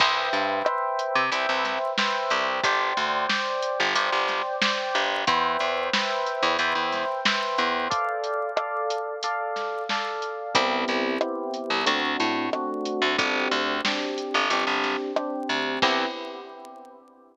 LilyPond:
<<
  \new Staff \with { instrumentName = "Electric Piano 1" } { \time 4/4 \key c \major \tempo 4 = 91 <b' c'' e'' g''>4 <b' c'' e'' g''>4 <b' c'' e'' g''>4 <b' c'' e'' g''>4 | <c'' d'' g''>4 <c'' d'' g''>4 <c'' d'' g''>4 <c'' d'' g''>4 | <b' c'' e'' g''>4 <b' c'' e'' g''>4 <b' c'' e'' g''>4 <b' c'' e'' g''>4 | <a' d'' f''>4 <a' d'' f''>4 <a' d'' f''>4 <a' d'' f''>4 |
<b c' e' g'>4 <b c' e' g'>4 <a c' d' fis'>4 <a c' d' fis'>4 | <c' d' g'>4 <c' d' g'>4 <c' d' g'>4 <c' d' g'>4 | <b c' e' g'>4 r2. | }
  \new Staff \with { instrumentName = "Electric Bass (finger)" } { \clef bass \time 4/4 \key c \major c,8 g,4~ g,16 c16 c,16 c,4~ c,16 c,8 | g,,8 d,4~ d,16 g,,16 g,,16 g,,4~ g,,16 g,,8 | e,8 e,4~ e,16 e,16 e,16 e,4~ e,16 e,8 | r1 |
c,8 c,4~ c,16 c,16 d,8 a,4~ a,16 d,16 | g,,8 d,4~ d,16 g,,16 g,,16 g,,4~ g,,16 d,8 | c,4 r2. | }
  \new DrumStaff \with { instrumentName = "Drums" } \drummode { \time 4/4 <cymc bd>8 hh8 ss8 hh8 hh8 <hh sn>8 sn8 hh8 | <hh bd>8 hh8 sn8 hh8 hh8 <hh sn>8 sn8 hh8 | <hh bd>8 hh8 sn8 hh8 hh8 <hh sn>8 sn8 hh8 | <hh bd>8 hh8 ss8 hh8 hh8 <hh sn>8 sn8 hh8 |
<hh bd>8 hh8 ss8 hh8 hh8 <hh sn>8 ss8 hh8 | <hh bd>8 hh8 sn8 hh8 hh8 <hh sn>8 ss8 hh8 | <cymc bd>4 r4 r4 r4 | }
>>